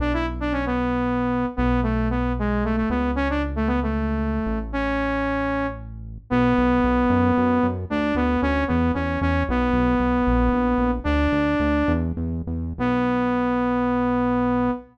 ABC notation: X:1
M:6/8
L:1/16
Q:3/8=76
K:Bdor
V:1 name="Lead 2 (sawtooth)"
D E z D C B,7 | B,2 A,2 B,2 G,2 A, A, B,2 | C D z A, B, A,7 | C8 z4 |
B,12 | D2 B,2 C2 B,2 C2 C2 | B,12 | "^rit." D8 z4 |
B,12 |]
V:2 name="Synth Bass 1" clef=bass
B,,,12 | B,,,10 C,,2- | C,,10 A,,,2- | A,,,12 |
B,,,2 B,,,2 B,,,2 F,,2 F,,2 F,,2 | D,,2 D,,2 D,,2 E,,2 E,,2 E,,2 | B,,,2 B,,,2 B,,,2 ^A,,,2 A,,,2 A,,,2 | "^rit." D,,2 D,,2 D,,2 E,,2 E,,2 E,,2 |
B,,,12 |]